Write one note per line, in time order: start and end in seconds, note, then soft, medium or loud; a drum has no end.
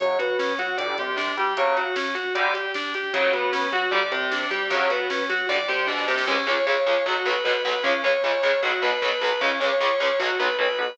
0.00 0.17 F#2 medium
0.00 0.18 C#3 medium
0.00 0.18 F#3 medium
0.00 0.17 C#5 medium
0.00 kick loud
0.00 closed hi-hat loud
0.10 kick medium
0.19 0.53 B2 medium
0.19 0.53 B3 medium
0.19 0.37 F#4 medium
0.19 kick medium
0.19 closed hi-hat medium
0.30 kick medium
0.39 0.57 C#4 medium
0.39 kick medium
0.39 snare loud
0.49 kick medium
0.59 0.76 F#3 medium
0.59 0.75 F#4 medium
0.59 0.77 F#4 medium
0.59 kick medium
0.59 closed hi-hat medium
0.68 kick medium
0.77 0.95 G1 medium
0.77 0.94 D3 medium
0.77 0.94 G3 medium
0.77 0.95 D5 medium
0.77 kick medium
0.77 closed hi-hat loud
0.88 kick medium
0.98 1.31 C2 medium
0.98 1.32 C3 medium
0.98 1.17 G4 medium
0.98 kick medium
0.98 closed hi-hat medium
1.08 kick medium
1.16 1.34 D4 medium
1.16 kick loud
1.16 snare loud
1.27 kick medium
1.37 1.54 G2 medium
1.37 1.54 G3 medium
1.37 1.57 G4 medium
1.37 kick medium
1.37 closed hi-hat medium
1.47 kick medium
1.57 1.81 C#3 medium
1.57 1.81 F#3 loud
1.57 1.76 C#5 medium
1.57 kick loud
1.57 closed hi-hat loud
1.67 kick medium
1.76 1.95 F#4 medium
1.76 kick medium
1.76 closed hi-hat medium
1.86 kick medium
1.96 2.14 C#4 medium
1.96 kick loud
1.96 snare loud
2.06 kick medium
2.15 2.33 F#4 medium
2.15 kick medium
2.15 closed hi-hat medium
2.25 kick medium
2.35 2.51 D3 medium
2.35 2.51 G3 medium
2.35 2.53 D5 medium
2.35 kick medium
2.35 closed hi-hat loud
2.45 kick medium
2.54 2.72 G4 medium
2.54 kick medium
2.54 closed hi-hat medium
2.65 kick medium
2.74 2.93 D4 medium
2.74 kick medium
2.74 snare loud
2.84 kick medium
2.94 3.13 G4 medium
2.94 kick medium
2.94 closed hi-hat medium
3.04 kick loud
3.13 3.30 F#2 medium
3.13 3.31 C#3 loud
3.13 3.31 F#3 medium
3.13 3.32 C#5 medium
3.13 kick loud
3.13 closed hi-hat loud
3.23 kick medium
3.33 3.67 B2 medium
3.33 3.67 B3 medium
3.33 3.51 F#4 medium
3.33 kick medium
3.33 closed hi-hat medium
3.43 kick medium
3.52 3.71 C#4 medium
3.52 kick medium
3.52 snare loud
3.63 kick medium
3.72 3.89 F#3 medium
3.72 3.90 F#4 medium
3.72 3.91 F#4 medium
3.72 kick medium
3.72 closed hi-hat medium
3.82 kick medium
3.91 4.09 G1 medium
3.91 4.00 D3 medium
3.91 4.00 G3 medium
3.91 4.09 D5 medium
3.91 kick medium
4.02 kick medium
4.12 4.45 C2 medium
4.12 4.45 C3 medium
4.12 4.30 G4 medium
4.12 kick medium
4.12 closed hi-hat medium
4.21 kick medium
4.31 4.50 D4 medium
4.31 kick loud
4.31 snare loud
4.41 kick medium
4.51 4.68 G2 medium
4.51 4.68 G3 medium
4.51 4.69 G4 medium
4.51 kick medium
4.51 closed hi-hat medium
4.61 kick medium
4.70 4.87 F#2 medium
4.70 4.88 C#3 medium
4.70 4.88 F#3 medium
4.70 4.89 C#5 medium
4.70 kick loud
4.70 closed hi-hat medium
4.80 kick medium
4.90 5.23 B2 medium
4.90 5.23 B3 medium
4.90 5.09 F#4 medium
4.90 kick medium
4.90 closed hi-hat medium
5.00 kick medium
5.10 5.28 C#4 medium
5.10 kick medium
5.10 snare loud
5.20 kick medium
5.29 5.46 F#3 medium
5.29 5.46 F#4 medium
5.29 5.48 F#4 medium
5.29 kick medium
5.29 closed hi-hat medium
5.39 kick medium
5.49 5.66 G1 medium
5.49 5.57 D3 medium
5.49 5.57 G3 loud
5.49 5.67 D5 medium
5.49 kick medium
5.49 snare medium
5.68 5.87 C2 medium
5.68 5.87 C3 medium
5.68 5.87 G4 medium
5.68 snare medium
5.87 6.06 B1 medium
5.87 6.06 B2 medium
5.87 6.05 D4 medium
5.87 snare medium
5.98 snare medium
6.08 6.26 C2 medium
6.08 6.25 C3 medium
6.08 6.26 G4 medium
6.08 snare medium
6.18 snare loud
6.27 6.35 C#2 medium
6.27 6.35 C#3 medium
6.27 6.35 G#3 loud
6.27 6.46 C#4 medium
6.27 kick loud
6.27 crash loud
6.47 6.55 C#2 medium
6.47 6.55 C#3 medium
6.47 6.55 G#3 medium
6.47 6.65 C#5 medium
6.66 6.75 C#2 medium
6.66 6.75 C#3 medium
6.66 6.75 G#3 medium
6.66 6.84 C#5 medium
6.66 kick medium
6.86 6.94 C#2 medium
6.86 6.94 C#3 medium
6.86 6.94 G#3 medium
6.86 7.04 C#5 medium
7.06 7.14 B1 medium
7.06 7.14 B2 medium
7.06 7.14 F#3 loud
7.06 7.25 F#4 medium
7.06 kick loud
7.25 7.33 B1 medium
7.25 7.33 B2 medium
7.25 7.33 F#3 medium
7.25 7.44 B4 medium
7.44 7.53 B1 medium
7.44 7.53 B2 medium
7.44 7.53 F#3 medium
7.44 7.63 B4 medium
7.44 kick loud
7.65 7.73 B1 medium
7.65 7.73 B2 medium
7.65 7.73 F#3 medium
7.65 7.83 B4 medium
7.83 7.92 C#2 medium
7.83 7.92 C#3 loud
7.83 7.92 G#3 medium
7.83 8.01 C#4 medium
7.83 kick loud
8.04 8.12 C#2 medium
8.04 8.12 C#3 medium
8.04 8.12 G#3 medium
8.04 8.23 C#5 medium
8.23 8.32 C#2 medium
8.23 8.32 C#3 medium
8.23 8.32 G#3 medium
8.23 8.42 C#5 medium
8.23 kick medium
8.42 8.51 C#2 medium
8.42 8.51 C#3 medium
8.42 8.51 G#3 medium
8.42 8.60 C#5 medium
8.63 8.71 B1 medium
8.63 8.71 B2 loud
8.63 8.71 F#3 medium
8.63 8.81 F#4 medium
8.63 kick medium
8.82 8.90 B1 medium
8.82 8.90 B2 medium
8.82 8.90 F#3 medium
8.82 9.01 B4 medium
9.02 9.10 B1 medium
9.02 9.10 B2 medium
9.02 9.10 F#3 medium
9.02 9.21 B4 medium
9.02 kick loud
9.21 9.29 B1 medium
9.21 9.29 B2 medium
9.21 9.29 F#3 medium
9.21 9.41 B4 medium
9.41 9.49 C#2 medium
9.41 9.49 C#3 medium
9.41 9.49 G#3 medium
9.41 9.59 C#4 medium
9.41 kick loud
9.60 9.69 C#2 medium
9.60 9.69 C#3 medium
9.60 9.69 G#3 medium
9.60 9.78 C#5 medium
9.80 9.88 C#2 medium
9.80 9.88 C#3 medium
9.80 9.88 G#3 medium
9.80 9.99 C#5 medium
9.80 kick loud
10.00 10.08 C#2 medium
10.00 10.08 C#3 medium
10.00 10.08 G#3 medium
10.00 10.19 C#5 medium
10.19 10.27 B1 loud
10.19 10.27 B2 medium
10.19 10.27 F#3 loud
10.19 10.38 F#4 medium
10.19 kick loud
10.39 10.47 B1 medium
10.39 10.47 B2 medium
10.39 10.47 F#3 medium
10.39 10.57 B4 medium
10.59 10.66 B1 medium
10.59 10.66 B2 medium
10.59 10.66 F#3 medium
10.59 10.78 B4 medium
10.59 kick medium
10.79 10.86 B1 medium
10.79 10.86 B2 medium
10.79 10.86 F#3 medium
10.79 10.97 B4 medium